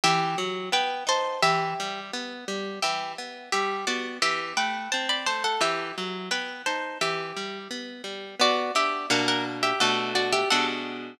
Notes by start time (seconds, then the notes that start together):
0.04 E3 G4 E5
0.38 F#3
0.72 B3 B4 G5
1.07 D#4 C5 A5
1.42 E3 G4 E5
1.80 G3
2.13 B3
2.48 G3
2.82 E3 G4 E5
3.18 B3
3.52 G3 G4 E5
3.87 B3 F#4 D5
4.22 E3 G4 E5
4.57 A3 B4 G5
4.92 C4 C5 A5
5.09 D5 B5
5.26 A3 C5 A5
5.44 A4 F#5
5.61 E3 G4 E5
5.98 F#3
6.31 B3 B4 G5
6.66 D#4 C5 A5
7.01 E3 G4 E5
7.36 G3
7.71 B3
8.04 G3
8.40 B3 F#4 D5
8.75 D4 G4 E5
9.10 B2 A#3 D4 F#4 A#4 F#5
9.28 A#4 F#5
9.63 G4 E5
9.80 B2 A3 D4 F#4 A4 F#5
10.15 F#4 D5
10.32 G4 E5
10.50 B2 G#3 D4 F#4 A4 F#5